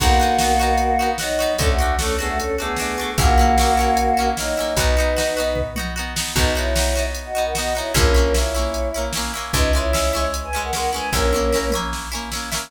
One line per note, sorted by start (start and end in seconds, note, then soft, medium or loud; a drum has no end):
0.00 1.46 B1 loud
0.00 1.09 A#3 medium
0.00 0.18 B3 loud
0.00 0.18 D#4 loud
0.00 1.09 F#4 medium
0.00 0.18 F#4 loud
0.00 kick loud
0.00 crash loud
0.20 0.38 B3 loud
0.20 0.38 D#4 loud
0.20 0.38 F#4 medium
0.38 0.58 D#4 medium
0.38 0.58 F#4 loud
0.38 snare loud
0.43 0.58 B3 medium
0.60 0.96 B3 medium
0.60 0.96 D#4 loud
0.60 0.96 F#4 loud
0.78 closed hi-hat medium
0.99 1.17 B3 medium
0.99 1.17 D#4 medium
0.99 1.17 F#4 medium
1.18 1.53 F#3 medium
1.18 1.53 D#4 medium
1.18 1.38 D#4 medium
1.18 1.38 F#4 loud
1.18 snare loud
1.23 1.38 B3 loud
1.39 1.57 B3 loud
1.39 1.57 D#4 loud
1.39 1.57 F#4 medium
1.58 3.05 D2 medium
1.58 1.77 A3 loud
1.58 1.68 C#4 medium
1.58 1.77 D4 loud
1.58 1.77 F#4 loud
1.58 1.68 A4 loud
1.58 kick loud
1.58 closed hi-hat loud
1.69 1.95 A3 medium
1.69 1.95 F#4 medium
1.79 1.97 A3 loud
1.79 1.97 D4 medium
1.79 1.97 F#4 loud
1.99 2.17 A3 medium
1.99 2.15 C#4 medium
1.99 2.17 D4 medium
1.99 2.17 F#4 medium
1.99 2.15 A4 medium
1.99 snare loud
2.19 2.55 A3 medium
2.19 2.28 B3 medium
2.19 2.55 D4 medium
2.19 2.55 F#4 loud
2.19 2.28 G#4 medium
2.28 2.38 A3 medium
2.28 2.38 F#4 medium
2.38 2.56 C#4 medium
2.38 2.56 A4 medium
2.38 closed hi-hat loud
2.58 2.77 A3 medium
2.58 3.10 B3 medium
2.58 2.77 D4 medium
2.58 2.77 F#4 medium
2.58 3.10 G#4 medium
2.76 2.96 D4 loud
2.76 2.96 F#4 medium
2.76 snare medium
2.81 2.96 A3 medium
2.98 3.16 A3 medium
2.98 3.16 D4 loud
2.98 3.16 F#4 loud
3.18 4.64 A#1 loud
3.18 4.28 A#3 medium
3.18 3.36 A#3 loud
3.18 3.36 C#4 loud
3.18 3.36 E4 loud
3.18 4.28 F#4 loud
3.18 kick loud
3.18 closed hi-hat loud
3.38 3.56 A#3 medium
3.38 3.56 C#4 loud
3.38 3.56 E4 medium
3.58 3.76 A#3 loud
3.58 3.76 C#4 loud
3.58 3.76 E4 medium
3.58 snare loud
3.77 4.14 A#3 loud
3.77 4.14 C#4 medium
3.77 4.14 E4 medium
3.97 closed hi-hat loud
4.17 4.35 A#3 medium
4.17 4.35 C#4 medium
4.17 4.35 E4 medium
4.37 4.73 F#3 medium
4.37 4.55 A#3 loud
4.37 4.55 C#4 medium
4.37 4.73 D#4 medium
4.37 4.55 E4 medium
4.37 snare loud
4.57 4.76 A#3 loud
4.57 4.76 C#4 medium
4.57 4.76 E4 medium
4.77 6.23 B1 loud
4.77 4.95 B3 loud
4.77 5.60 D#4 medium
4.77 4.95 D#4 loud
4.77 4.95 F#4 loud
4.77 5.60 B4 medium
4.77 kick loud
4.77 closed hi-hat loud
4.97 5.15 B3 loud
4.97 5.15 D#4 loud
4.97 5.15 F#4 loud
5.16 5.35 B3 loud
5.16 5.35 D#4 loud
5.16 5.35 F#4 loud
5.16 snare loud
5.37 5.73 B3 loud
5.37 5.73 D#4 medium
5.37 5.73 F#4 medium
5.55 kick medium
5.55 floor tom medium
5.76 5.94 B3 loud
5.76 5.94 D#4 medium
5.76 5.94 F#4 medium
5.76 mid tom medium
5.96 6.14 B3 medium
5.96 6.14 D#4 loud
5.96 6.14 F#4 medium
6.16 6.34 B3 medium
6.16 6.34 D#4 loud
6.16 6.34 F#4 medium
6.16 snare loud
6.36 7.82 B1 loud
6.36 6.54 B3 loud
6.36 6.52 D#4 medium
6.36 6.54 D#4 loud
6.36 6.54 F#4 loud
6.36 6.52 B4 medium
6.36 kick loud
6.36 crash loud
6.55 6.74 B3 medium
6.55 6.74 D#4 loud
6.55 7.05 E4 medium
6.55 6.74 F#4 medium
6.55 7.05 C#5 medium
6.75 6.94 B3 loud
6.75 6.94 D#4 loud
6.75 6.94 F#4 medium
6.75 snare loud
6.95 7.32 B3 loud
6.95 7.32 D#4 medium
6.95 7.32 F#4 loud
7.15 closed hi-hat loud
7.25 7.43 F#4 medium
7.25 7.43 D#5 medium
7.35 7.53 B3 medium
7.35 7.53 D#4 medium
7.35 7.53 F#4 loud
7.45 7.54 A#4 medium
7.45 7.54 F#5 medium
7.55 7.73 B3 loud
7.55 7.73 D#4 medium
7.55 7.74 F#4 medium
7.55 7.73 F#4 loud
7.55 7.74 D#5 medium
7.55 snare loud
7.75 7.93 B3 medium
7.75 7.93 D#4 loud
7.75 7.92 E4 medium
7.75 7.93 F#4 medium
7.75 7.92 C#5 medium
7.94 9.41 A#1 loud
7.94 8.13 A#3 loud
7.94 8.33 C#4 medium
7.94 8.13 C#4 loud
7.94 8.13 E4 loud
7.94 8.33 A#4 medium
7.94 kick loud
7.94 closed hi-hat loud
8.14 8.33 A#3 medium
8.14 8.33 C#4 loud
8.14 8.33 E4 loud
8.34 8.53 A#3 loud
8.34 8.53 C#4 medium
8.34 9.04 E4 medium
8.34 8.53 E4 loud
8.34 9.04 C#5 medium
8.34 snare loud
8.54 8.91 A#3 medium
8.54 8.91 C#4 medium
8.54 8.91 E4 loud
8.74 closed hi-hat loud
8.94 9.13 A#3 medium
8.94 9.13 C#4 medium
8.94 9.13 E4 loud
9.13 9.32 C#4 medium
9.13 9.32 E4 medium
9.13 snare loud
9.17 9.32 A#3 loud
9.34 9.52 A#3 medium
9.34 9.52 C#4 medium
9.34 9.52 E4 medium
9.53 11.00 C#2 loud
9.53 9.72 G#3 loud
9.53 9.72 C#4 loud
9.53 9.70 D#4 medium
9.53 9.72 E4 loud
9.53 9.70 B4 medium
9.53 kick loud
9.53 closed hi-hat loud
9.73 9.91 G#3 loud
9.73 9.91 C#4 loud
9.73 9.91 E4 medium
9.73 10.24 E4 medium
9.73 10.24 C#5 medium
9.93 10.12 G#3 loud
9.93 10.12 C#4 medium
9.93 10.12 E4 loud
9.93 snare loud
10.13 10.50 G#3 loud
10.13 10.50 C#4 loud
10.13 10.50 E4 loud
10.34 closed hi-hat loud
10.43 10.61 B4 medium
10.43 10.61 G#5 medium
10.53 10.71 G#3 loud
10.53 10.71 C#4 medium
10.53 10.71 E4 medium
10.63 10.72 A#4 medium
10.63 10.72 F#5 medium
10.73 10.91 G#3 medium
10.73 10.91 C#4 medium
10.73 10.91 E4 loud
10.73 10.90 A#4 medium
10.73 10.90 F#5 medium
10.73 snare loud
10.93 11.11 G#3 medium
10.93 11.11 C#4 medium
10.93 11.11 E4 medium
10.93 11.10 B4 medium
10.93 11.10 G#5 medium
11.12 12.59 A#1 loud
11.12 11.31 A#3 loud
11.12 11.69 C#4 medium
11.12 11.31 C#4 loud
11.12 11.31 E4 loud
11.12 11.69 A#4 medium
11.12 kick medium
11.12 snare medium
11.33 11.51 A#3 medium
11.33 11.51 C#4 medium
11.33 11.51 E4 loud
11.33 high tom medium
11.52 11.71 A#3 loud
11.52 11.71 C#4 medium
11.52 11.71 E4 medium
11.52 snare medium
11.70 12.09 C#4 medium
11.70 12.09 E4 medium
11.70 mid tom medium
11.75 12.09 A#3 loud
11.93 snare medium
12.12 12.30 A#3 medium
12.12 12.30 C#4 loud
12.12 12.30 E4 loud
12.32 12.50 A#3 medium
12.32 12.50 C#4 medium
12.32 12.50 E4 medium
12.32 snare medium
12.52 12.70 A#3 medium
12.52 12.70 C#4 medium
12.52 12.70 E4 loud
12.52 snare loud